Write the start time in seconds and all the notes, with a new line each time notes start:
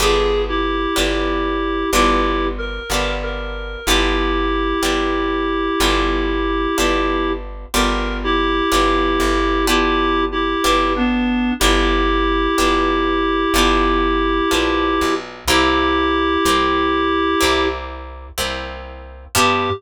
0.00 G1 B3 D4 F4 G4 G#4
0.48 E4 G4
0.96 G1 B3 D4 F4 G4
1.93 G1 B3 D4 E4 F4 G4
2.58 A#4
2.90 G1 B3 D4 F4 G4
3.23 A#4
3.86 G1 B3 D4 E4 F4 G4
4.82 G1 B3 D4 F4 G4
5.80 G1 B3 D4 F4 G4
6.78 G1 B3 D4 F4 G4
7.74 G1 B3 D4 F4 G4 A#4
8.24 E4 G4
8.72 G1 B3 D4 F4 G4
9.20 G1
9.67 B3 D4 E4 F4 G4
10.32 E4 G4
10.64 G1 B3 D4 F4 G4
10.96 B3 D4
11.60 G1 B3 D4 E4 F4 G4
12.58 G1 B3 D4 F4 G4
13.54 G1 B3 D4 F4 G4
14.51 A#1 B3 D4 F4 G4
15.01 B1
15.48 C2 A#3 C4 E4 G4
16.45 C2 A#3 C4 E4 G4
17.41 C2 A#3 C4 E4 G4
18.38 C2 A#3 C4 E4 G4
19.35 G2 B3 D4 F4 G4